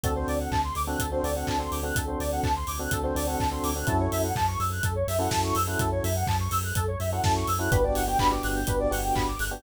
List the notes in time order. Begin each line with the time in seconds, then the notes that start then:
0.04 D2 C4 D4 F#4 A4, kick, closed hi-hat
0.16 C4 D4 F#4 A4 C5
0.28 D2 D5, open hi-hat
0.40 F#5
0.52 D2 A5, kick, clap
0.64 C6
0.75 D2 D6, open hi-hat
0.87 C4 D4 F#4 A4 F#6
0.99 D2 A4, kick, closed hi-hat
1.12 C4 D4 F#4 A4 C5
1.23 D2 C4 D4 F#4 A4 D5, open hi-hat
1.36 C4 D4 F#4 A4 F#5
1.47 D2 A5, kick, clap
1.59 C4 D4 F#4 A4 C6
1.72 D2 D6, open hi-hat
1.83 C4 D4 F#4 A4 F#6
1.96 D2 A4, kick, closed hi-hat
2.07 C4 D4 F#4 A4 C5
2.20 D2 D5, open hi-hat
2.32 F#5
2.43 D2 A5, kick, clap
2.56 C6
2.67 D2 D6, open hi-hat
2.79 C4 D4 F#4 A4 F#6
2.91 D2 A4, kick, closed hi-hat
3.04 C4 D4 F#4 A4 C5
3.15 D2 C4 D4 F#4 A4 D5, open hi-hat
3.27 C4 D4 F#4 A4 F#5
3.40 D2 A5, kick, clap
3.51 C4 D4 F#4 A4 C6
3.64 D2 D6, open hi-hat
3.76 C4 D4 F#4 A4 F#6
3.87 F#2 C#4 E4 F#4 A4, kick, closed hi-hat
4.00 C#5
4.12 F#2 E5, open hi-hat
4.24 F#5
4.36 F#2 A5, kick, clap
4.48 C#6
4.60 F#2 E6, open hi-hat
4.72 F#6
4.83 F#2 A4, kick, closed hi-hat
4.96 C#5
5.08 F#2 E5, open hi-hat
5.19 C#4 E4 F#4 A4 F#5
5.31 F#2 A5, kick, snare
5.44 C#6
5.55 F#2 E6, open hi-hat
5.67 C#4 E4 F#4 A4 F#6
5.79 F#2 A4, kick, closed hi-hat
5.92 C#5
6.04 F#2 E5, open hi-hat
6.16 F#5
6.27 F#2 A5, kick, clap
6.40 C#6
6.51 F#2 E6, open hi-hat
6.64 F#6
6.75 F#2 A4, kick, closed hi-hat
6.88 C#5
7.00 F#2 E5, open hi-hat
7.12 C#4 E4 F#4 A4 F#5
7.24 F#2 A5, kick, snare
7.36 C#6
7.48 F#2 E6, open hi-hat
7.59 C#4 E4 F#4 A4 F#6
7.71 G1 B3 D4 F#4 G4 B4, kick, closed hi-hat
7.84 B3 D4 F#4 G4 D5
7.95 G1 F#5, open hi-hat
8.07 B3 D4 F#4 G4 G5
8.19 G1 B3 D4 F#4 G4 B5, kick, clap
8.31 B3 D4 F#4 G4 D6
8.43 G1 F#6, open hi-hat
8.56 G6
8.67 G1 B3 D4 F#4 G4 B4, kick, closed hi-hat
8.80 D5
8.91 G1 B3 D4 F#4 G4 F#5, open hi-hat
9.04 G5
9.15 G1 B5, kick, clap
9.28 D6
9.39 G1 F#6, open hi-hat
9.51 B3 D4 F#4 G4 G6